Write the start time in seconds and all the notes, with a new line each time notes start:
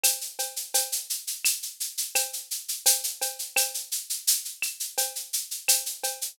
0.04 cowbell, claves, shaker
0.21 shaker
0.39 cowbell, shaker
0.56 shaker
0.74 cowbell, shaker
0.92 shaker
1.10 shaker
1.27 shaker
1.45 claves, shaker
1.62 shaker
1.80 shaker
1.98 shaker
2.15 cowbell, claves, shaker
2.33 shaker
2.51 shaker
2.68 shaker
2.86 cowbell, shaker
3.04 shaker
3.21 cowbell, shaker
3.39 shaker
3.56 cowbell, claves, shaker
3.74 shaker
3.92 shaker
4.10 shaker
4.27 shaker
4.45 shaker
4.62 claves, shaker
4.80 shaker
4.98 cowbell, shaker
5.15 shaker
5.33 shaker
5.51 shaker
5.68 cowbell, claves, shaker
5.86 shaker
6.04 cowbell, shaker
6.21 shaker